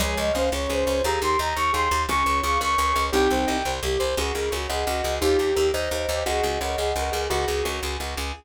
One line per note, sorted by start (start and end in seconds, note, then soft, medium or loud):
0.00 0.15 C#2 medium
0.00 0.30 F3 medium
0.00 0.30 G#3 medium
0.00 0.17 G#4 medium
0.00 0.15 C#5 medium
0.17 0.32 C#2 medium
0.17 0.33 C#5 medium
0.17 0.32 D#5 medium
0.33 0.50 C#2 medium
0.33 0.50 A#3 medium
0.33 0.50 C#4 medium
0.33 0.48 C5 medium
0.33 0.49 F5 medium
0.52 0.67 C#2 medium
0.52 1.00 C#4 medium
0.52 1.00 F4 medium
0.52 0.68 C#5 medium
0.52 0.70 C#5 medium
0.69 0.84 C#2 medium
0.69 0.85 G#4 medium
0.69 1.03 C5 medium
0.86 1.02 C#2 medium
0.86 1.01 C#5 medium
1.04 1.19 D#2 medium
1.04 1.38 G4 medium
1.04 1.21 G#4 medium
1.04 1.38 A#4 medium
1.04 1.20 A#5 medium
1.22 1.37 D#2 medium
1.22 1.37 A#4 medium
1.22 1.38 C6 medium
1.39 1.54 D#2 medium
1.39 1.55 D#5 medium
1.39 1.57 A#5 medium
1.56 1.71 D#2 medium
1.56 1.71 A#4 medium
1.56 1.72 C#6 medium
1.73 1.89 D#2 medium
1.73 1.88 G#4 medium
1.73 2.02 C6 medium
1.91 2.06 D#2 medium
1.91 2.07 A#4 medium
2.09 2.23 C#2 medium
2.09 2.42 C#4 medium
2.09 2.42 F4 loud
2.09 2.24 G#4 medium
2.09 2.38 C#6 medium
2.26 2.41 C#2 medium
2.26 2.41 C#5 medium
2.43 2.58 C#2 medium
2.43 2.58 F4 medium
2.43 2.58 G#4 medium
2.43 2.59 F5 medium
2.43 2.59 C#6 medium
2.60 2.76 C#2 medium
2.60 3.02 A#4 medium
2.60 3.02 C#5 medium
2.60 2.77 C#5 medium
2.60 3.04 C#6 medium
2.78 2.93 C#2 medium
2.78 2.95 G#4 medium
2.95 3.10 C#2 medium
2.95 3.10 C#5 medium
3.12 3.28 C2 medium
3.12 3.58 C4 medium
3.12 3.58 D#4 medium
3.12 3.28 G4 medium
3.12 3.72 G5 medium
3.30 3.45 C2 medium
3.30 3.47 C5 medium
3.47 3.63 C2 medium
3.47 3.63 D#5 medium
3.65 3.80 C2 medium
3.65 3.81 C5 medium
3.83 3.97 C2 medium
3.83 4.00 G4 medium
3.99 4.15 C2 medium
3.99 4.15 C5 medium
4.17 4.32 C#2 medium
4.17 4.53 F4 medium
4.17 4.33 F#4 medium
4.17 4.34 G#4 medium
4.17 4.53 G#4 medium
4.34 4.50 C#2 medium
4.34 4.51 G#4 medium
4.34 4.50 A#4 medium
4.51 4.67 C#2 medium
4.51 4.68 F#4 medium
4.51 4.68 A#4 medium
4.51 4.66 C#5 medium
4.51 4.68 C#5 medium
4.69 4.84 C#2 medium
4.69 4.86 G#4 medium
4.69 4.85 G#4 medium
4.69 5.15 D#5 medium
4.69 5.15 F#5 medium
4.87 5.02 C#2 medium
4.87 5.19 F#4 medium
4.87 5.03 F#4 medium
5.03 5.19 C#2 medium
5.03 5.19 G#4 medium
5.21 5.37 D#2 medium
5.21 5.51 D#4 medium
5.21 5.37 F4 medium
5.21 5.67 G4 medium
5.21 5.51 G4 medium
5.39 5.54 D#2 medium
5.39 5.54 G4 medium
5.55 5.71 D#2 medium
5.55 5.72 G4 medium
5.55 5.71 A#4 medium
5.55 5.72 A#4 medium
5.74 5.89 D#2 medium
5.74 6.23 C5 medium
5.74 6.23 D#5 medium
5.74 5.90 D#5 medium
5.91 6.06 D#2 medium
5.91 6.08 A#4 medium
6.09 6.23 D#2 medium
6.09 6.25 G4 medium
6.26 6.41 C#2 medium
6.26 6.42 F#4 medium
6.26 6.44 G#4 medium
6.26 6.59 D#5 medium
6.26 6.59 F#5 medium
6.43 6.58 C#2 medium
6.43 6.59 F#4 medium
6.43 6.59 G#4 medium
6.61 6.76 C#2 medium
6.61 6.77 A#4 medium
6.61 6.77 C#5 medium
6.61 6.77 D#5 medium
6.61 6.77 F#5 medium
6.76 6.93 C#2 medium
6.76 6.90 G#4 medium
6.76 6.94 G#4 medium
6.76 7.21 D#5 medium
6.76 7.21 F#5 medium
6.96 7.10 C#2 medium
6.96 7.12 F#4 medium
6.96 7.27 A#4 medium
7.12 7.28 C#2 medium
7.12 7.28 G#4 medium
7.30 7.45 C#2 medium
7.30 7.62 F4 medium
7.30 7.46 F#4 loud
7.30 7.96 F#4 medium
7.30 7.62 G#4 loud
7.48 7.63 C#2 medium
7.48 7.64 G#4 medium
7.65 7.80 C#2 medium
7.65 7.80 A#4 medium
7.65 7.80 C#5 medium
7.65 7.81 C#5 medium
7.83 7.97 C#2 medium
7.83 7.99 G#4 medium
8.00 8.15 C#2 medium
8.00 8.16 F#4 medium
8.17 8.32 C#2 medium
8.17 8.32 G#4 medium